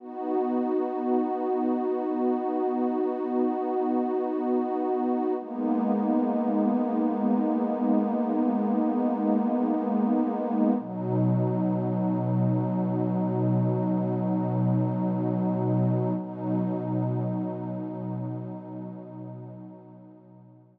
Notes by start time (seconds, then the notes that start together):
0.00 B3 D#4 F#4
5.39 G#3 A#3 B3 D#4
10.79 B2 F#3 D#4
16.18 B2 F#3 D#4